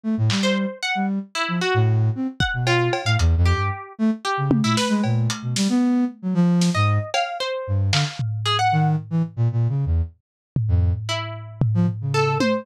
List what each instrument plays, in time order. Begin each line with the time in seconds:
0.04 flute A3
0.18 flute A2
0.30 flute G3, clap
0.43 harpsichord C5
0.83 harpsichord F#5
0.95 flute G3
1.35 harpsichord E4
1.48 flute F3
1.62 harpsichord F#4
1.74 flute A2
2.15 flute C4
2.40 harpsichord F#5, kick
2.54 flute B2
2.67 harpsichord F4, cowbell
2.93 cowbell
3.05 flute A2, harpsichord F5
3.19 flute E2, closed hi-hat
3.37 flute F2
3.46 harpsichord G4
3.54 flute G2
3.99 flute A3
4.25 harpsichord G4
4.38 flute C#3
4.51 high tom
4.64 flute A#2, harpsichord E4
4.77 harpsichord B4, snare
4.89 flute G#3
5.04 flute A#2, cowbell
5.30 closed hi-hat
5.42 flute B2
5.56 flute G3, snare
5.69 flute B3
6.22 flute F#3
6.34 flute F3
6.62 snare
6.75 flute G#2, harpsichord D#5
7.14 harpsichord F5, cowbell
7.40 harpsichord C5
7.67 flute G2
7.92 flute D3, harpsichord F5, clap
8.19 floor tom
8.46 harpsichord G#4, closed hi-hat
8.59 harpsichord F#5
8.72 flute D#3
9.11 flute E3
9.37 flute A#2
9.52 flute A#2
9.69 flute C#3
9.86 flute E2
10.56 floor tom
10.68 flute F2
11.09 harpsichord E4
11.62 floor tom
11.75 flute F3
11.88 floor tom
12.01 flute C#3
12.14 harpsichord A4
12.40 harpsichord C5, high tom